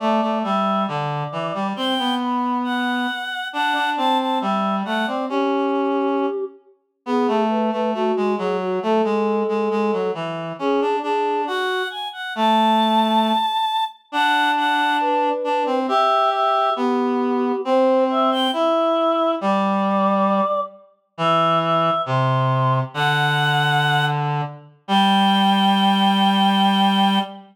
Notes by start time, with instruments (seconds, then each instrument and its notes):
0.00 clarinet A3, choir aahs D5
0.22 clarinet A3
0.43 clarinet G3, choir aahs E5
0.87 clarinet D3, choir aahs D5
1.32 clarinet E3
1.54 clarinet G3
1.76 clarinet C4, choir aahs G5
1.99 clarinet B3
2.20 choir aahs B5
2.64 choir aahs F#5
3.53 clarinet D4, choir aahs F#5
3.75 clarinet D4
3.97 clarinet C4, choir aahs A5
4.19 choir aahs A5
4.40 clarinet G3, choir aahs E5
4.85 clarinet A3, choir aahs F#5
5.07 clarinet C4, choir aahs D5
5.29 clarinet C#4, choir aahs G4
7.06 clarinet B3, choir aahs G#4
7.28 clarinet A3
7.50 choir aahs B4
7.72 clarinet A3, choir aahs B4
7.94 clarinet A3, choir aahs F#4
8.16 clarinet G#3
8.38 clarinet F#3, choir aahs G#4
8.61 choir aahs F#4
8.83 clarinet A3, choir aahs A4
9.04 clarinet G#3
9.48 clarinet G#3
9.71 clarinet G#3
9.93 clarinet F#3
10.14 clarinet E3
10.59 clarinet C#4, choir aahs G#4
10.81 clarinet D4
11.03 clarinet D4, choir aahs G#4
11.47 clarinet F#4, choir aahs F#5
11.90 choir aahs G#5
12.13 choir aahs F#5
12.35 clarinet A3, choir aahs A5
14.12 clarinet D4, choir aahs F#5
14.56 choir aahs F#5
15.01 choir aahs B4
15.44 clarinet D4
15.66 clarinet C4
15.88 clarinet G4, choir aahs E5
16.32 choir aahs E5
16.76 clarinet B3, choir aahs G4
17.65 clarinet C4, choir aahs C5
18.10 choir aahs E5
18.32 choir aahs G5
18.53 clarinet E4, choir aahs E5
19.41 clarinet G3, choir aahs D5
21.18 clarinet E3, choir aahs E5
21.62 choir aahs E5
22.06 clarinet C3, choir aahs C6
22.94 clarinet D3, choir aahs F#5
24.88 clarinet G3, choir aahs G5